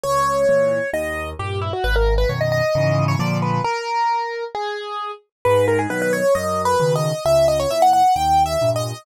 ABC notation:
X:1
M:4/4
L:1/16
Q:1/4=133
K:G#m
V:1 name="Acoustic Grand Piano"
c8 d4 =G2 E F | B A2 B c d d5 c =d2 B2 | A8 G6 z2 | B2 A G B B c2 (3d4 B4 d4 |
e2 d c e f f2 (3=g4 e4 d4 |]
V:2 name="Acoustic Grand Piano" clef=bass
C,,4 [A,,E,]4 D,,4 [=G,,A,,]4 | G,,,4 [F,,B,,D,]4 [G,,C,E,]4 [A,,=D,^E,]4 | z16 | G,,4 [B,,D,F,]4 F,,4 [B,,C,D,]4 |
C,,4 [A,,E,]4 D,,4 [=G,,A,,]4 |]